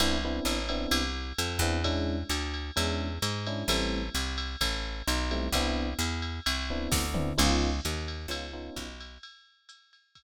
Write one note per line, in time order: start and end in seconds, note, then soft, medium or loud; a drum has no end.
0.00 0.40 C2 medium
0.00 0.17 B3 medium
0.00 0.17 C4 medium
0.00 0.17 D4 loud
0.00 0.17 E4 loud
0.00 ride loud
0.25 0.57 B3 medium
0.25 0.57 C4 medium
0.25 0.57 D4 medium
0.25 0.57 E4 medium
0.45 0.87 A1 medium
0.45 hi-hat pedal medium
0.45 ride medium
0.69 1.02 B3 medium
0.69 1.02 C4 medium
0.69 1.02 D4 medium
0.69 1.02 E4 medium
0.69 ride medium
0.91 1.33 C2 medium
0.91 ride loud
1.38 1.60 F2 medium
1.38 hi-hat pedal medium
1.38 ride medium
1.59 2.24 E2 loud
1.59 1.78 B3 medium
1.59 1.78 C4 medium
1.59 1.78 D4 medium
1.59 1.78 E4 medium
1.59 ride medium
1.84 2.17 G#3 loud
1.84 2.17 C#4 loud
1.84 2.17 D4 loud
1.84 2.17 E4 medium
1.84 kick soft
1.84 ride medium
2.29 2.71 D2 medium
2.29 hi-hat pedal medium
2.29 ride medium
2.54 ride medium
2.76 3.19 E2 medium
2.76 3.08 G#3 medium
2.76 3.08 C#4 medium
2.76 3.08 D4 medium
2.76 3.08 E4 medium
2.76 ride medium
3.22 3.64 G#2 medium
3.22 hi-hat pedal medium
3.22 ride medium
3.47 3.63 G#3 medium
3.47 3.63 C#4 medium
3.47 3.63 D4 medium
3.47 3.63 E4 medium
3.47 ride medium
3.68 4.09 A1 medium
3.68 4.01 G3 loud
3.68 4.01 A3 loud
3.68 4.01 C4 loud
3.68 4.01 E4 loud
3.68 ride loud
4.15 4.56 C2 medium
4.15 hi-hat pedal medium
4.15 ride medium
4.38 ride medium
4.61 5.02 A1 medium
4.61 kick medium
4.61 ride loud
5.07 5.49 B1 medium
5.07 hi-hat pedal medium
5.07 ride medium
5.31 5.47 G3 medium
5.31 5.47 A3 medium
5.31 5.47 C4 medium
5.31 5.47 E4 medium
5.31 ride medium
5.52 5.94 C2 medium
5.52 5.87 B3 loud
5.52 5.87 C4 medium
5.52 5.87 D4 loud
5.52 5.87 E4 loud
5.52 kick medium
5.52 ride medium
5.99 6.40 E2 medium
5.99 hi-hat pedal medium
5.99 ride medium
6.22 ride medium
6.46 6.88 C2 medium
6.46 ride loud
6.70 7.02 B3 medium
6.70 7.02 C4 medium
6.70 7.02 D4 medium
6.70 7.02 E4 medium
6.92 7.33 D2 medium
6.92 kick medium
6.92 snare medium
7.14 7.30 B3 medium
7.14 7.30 C4 medium
7.14 7.30 D4 medium
7.14 7.30 E4 medium
7.14 mid tom medium
7.38 7.80 C#2 loud
7.38 7.70 B3 loud
7.38 7.70 C#4 medium
7.38 7.70 D#4 loud
7.38 7.70 F4 loud
7.38 crash medium
7.38 ride medium
7.85 8.27 D#2 medium
7.85 hi-hat pedal medium
7.85 ride medium
8.08 ride medium
8.28 8.70 C#2 medium
8.28 8.46 B3 medium
8.28 8.46 C#4 medium
8.28 8.46 D#4 medium
8.28 8.46 F4 medium
8.28 ride medium
8.53 8.86 B3 medium
8.53 8.86 C#4 medium
8.53 8.86 D#4 medium
8.53 8.86 F4 medium
8.76 9.18 B1 medium
8.76 kick medium
8.76 hi-hat pedal medium
8.76 ride medium
9.00 ride medium
9.23 ride medium
9.69 hi-hat pedal medium
9.69 ride medium
9.93 ride medium
10.15 kick medium
10.15 ride medium